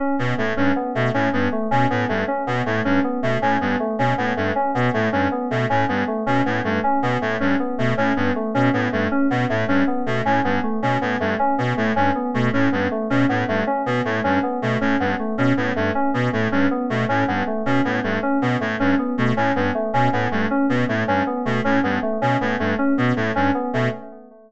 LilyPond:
<<
  \new Staff \with { instrumentName = "Clarinet" } { \clef bass \time 6/8 \tempo 4. = 105 r8 b,8 a,8 g,8 r8 b,8 | a,8 g,8 r8 b,8 a,8 g,8 | r8 b,8 a,8 g,8 r8 b,8 | a,8 g,8 r8 b,8 a,8 g,8 |
r8 b,8 a,8 g,8 r8 b,8 | a,8 g,8 r8 b,8 a,8 g,8 | r8 b,8 a,8 g,8 r8 b,8 | a,8 g,8 r8 b,8 a,8 g,8 |
r8 b,8 a,8 g,8 r8 b,8 | a,8 g,8 r8 b,8 a,8 g,8 | r8 b,8 a,8 g,8 r8 b,8 | a,8 g,8 r8 b,8 a,8 g,8 |
r8 b,8 a,8 g,8 r8 b,8 | a,8 g,8 r8 b,8 a,8 g,8 | r8 b,8 a,8 g,8 r8 b,8 | a,8 g,8 r8 b,8 a,8 g,8 |
r8 b,8 a,8 g,8 r8 b,8 | a,8 g,8 r8 b,8 a,8 g,8 | r8 b,8 a,8 g,8 r8 b,8 | a,8 g,8 r8 b,8 a,8 g,8 |
r8 b,8 a,8 g,8 r8 b,8 | }
  \new Staff \with { instrumentName = "Electric Piano 2" } { \time 6/8 des'8 b8 a8 des'8 b8 a8 | des'8 b8 a8 des'8 b8 a8 | des'8 b8 a8 des'8 b8 a8 | des'8 b8 a8 des'8 b8 a8 |
des'8 b8 a8 des'8 b8 a8 | des'8 b8 a8 des'8 b8 a8 | des'8 b8 a8 des'8 b8 a8 | des'8 b8 a8 des'8 b8 a8 |
des'8 b8 a8 des'8 b8 a8 | des'8 b8 a8 des'8 b8 a8 | des'8 b8 a8 des'8 b8 a8 | des'8 b8 a8 des'8 b8 a8 |
des'8 b8 a8 des'8 b8 a8 | des'8 b8 a8 des'8 b8 a8 | des'8 b8 a8 des'8 b8 a8 | des'8 b8 a8 des'8 b8 a8 |
des'8 b8 a8 des'8 b8 a8 | des'8 b8 a8 des'8 b8 a8 | des'8 b8 a8 des'8 b8 a8 | des'8 b8 a8 des'8 b8 a8 |
des'8 b8 a8 des'8 b8 a8 | }
>>